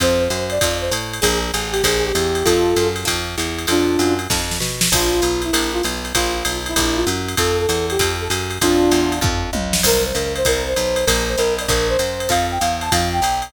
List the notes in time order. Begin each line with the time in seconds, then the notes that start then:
0.00 F2 C4 D#4 F4 A4 C5, kick, ride
0.20 C5
0.30 F#2, hi-hat pedal, ride
0.50 D5, ride
0.61 F2 C4 D#4 F4 A4, kick, ride
0.82 C5
0.91 A2, hi-hat pedal, ride
1.13 ride
1.21 A#1 D4 F4 G#4 A#4, kick, ride
1.53 A1 G#4, hi-hat pedal, ride
1.72 G4, ride
1.83 A#1 D4 F4 G#4 A#4, kick, ride
2.05 G4
2.15 E2, hi-hat pedal, ride
2.35 ride
2.45 F2 C4 D#4 F4 A4, kick, ride
2.76 F#2, hi-hat pedal, ride
2.96 ride
3.05 F2 C4 D#4 F4 A4, kick, ride
3.38 E2, hi-hat pedal, ride
3.58 ride
3.67 F2 C4 D4 D#4 F4 A4, ride
3.99 F#2, hi-hat pedal, ride
4.19 ride
4.30 F2 C4 D#4 F4 A4, kick, snare
4.51 snare
4.60 B2, snare
4.81 snare
4.92 A#1 D4 F4 G#4 A#4, kick, crash, ride
5.12 F4
5.22 B1, hi-hat pedal, ride
5.42 E4, ride
5.53 A#1 D4 F4 G#4 A#4, ride
5.73 F4
5.83 B1, hi-hat pedal, ride
6.05 ride
6.15 A#1 D4 F4 G#4 A#4, kick, ride
6.34 F4
6.45 B1, hi-hat pedal, ride
6.66 E4, ride
6.76 A#1 D4 F4 G#4 A#4, kick, ride
6.96 F4
7.07 F#2, hi-hat pedal, ride
7.28 ride
7.37 F2 C4 D#4 F4 A4, kick, ride
7.60 A4
7.69 E2, hi-hat pedal, ride
7.90 G4, ride
7.99 F2 C4 D#4 F4 A4, kick, ride
8.21 A4
8.30 F#2, hi-hat pedal, ride
8.51 ride
8.61 F2 C4 D4 D#4 F4 A4, kick, ride
8.91 E2, hi-hat pedal, ride
9.12 ride
9.21 F2 C4 D#4 F4 A4, kick, floor tom
9.53 C#2, high tom
9.73 snare
9.83 C2 C4 E4 G4 A#4, kick, crash, ride
10.04 C5
10.15 C#2 A#4, hi-hat pedal, ride
10.36 C5, ride
10.45 C2 C4 E4 G4 A#4, kick, ride
10.68 C5
10.76 B1, hi-hat pedal, ride
10.96 ride
11.06 A#1 D4 F4 G#4 A#4, kick, ride
11.28 C5
11.37 B1 A#4, hi-hat pedal, ride
11.59 D5, ride
11.68 A#1 D4 F4 G#4 A#4, kick, ride
11.89 C5
11.99 F#2, hi-hat pedal, ride
12.20 ride
12.29 F2 C4 D#4 F4 A4 F5, kick, ride
12.51 G5
12.60 E2 F5, hi-hat pedal, ride
12.81 A5, ride
12.91 F2 C4 D#4 F4 A4 F5, kick, ride
13.13 G5
13.22 B1, hi-hat pedal, ride
13.42 ride